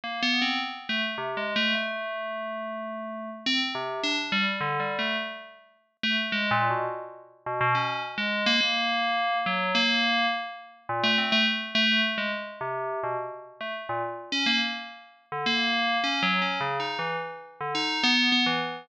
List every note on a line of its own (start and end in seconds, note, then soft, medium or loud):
0.04 0.21 A#3 medium
0.23 0.40 B3 loud
0.42 0.59 C4 medium
0.89 1.02 A3 medium
1.18 1.35 C3 medium
1.37 1.54 G#3 medium
1.56 1.73 A3 loud
1.75 3.29 A3 medium
3.46 3.59 C4 loud
3.75 4.00 C3 medium
4.03 4.16 D4 medium
4.32 4.45 G3 loud
4.61 4.78 D3 medium
4.80 4.97 G3 medium
4.99 5.16 A3 medium
6.03 6.16 A3 loud
6.32 6.49 G#3 medium
6.51 6.68 A#2 loud
6.70 6.87 B2 soft
7.46 7.59 B2 medium
7.61 7.74 B2 loud
7.75 8.00 C#4 medium
8.18 8.43 G#3 medium
8.46 8.59 A#3 loud
8.61 9.38 A#3 medium
9.46 9.72 F#3 medium
9.75 10.26 A#3 loud
10.89 11.02 A#2 medium
11.03 11.16 A3 loud
11.18 11.31 C4 soft
11.32 11.45 A3 loud
11.75 12.01 A3 loud
12.18 12.30 G#3 medium
12.61 12.99 C3 medium
13.03 13.16 B2 medium
13.61 13.73 A3 medium
13.89 14.02 A#2 medium
14.32 14.45 C#4 medium
14.46 14.59 A#3 loud
15.32 15.45 D3 medium
15.46 15.98 A#3 loud
16.04 16.21 C#4 medium
16.23 16.40 F#3 loud
16.42 16.59 C#4 medium
16.61 16.78 C#3 medium
16.80 16.97 D#4 medium
16.99 17.16 E3 medium
17.60 17.73 D3 medium
17.75 18.00 D#4 medium
18.03 18.29 B3 loud
18.32 18.45 B3 loud
18.46 18.59 E3 medium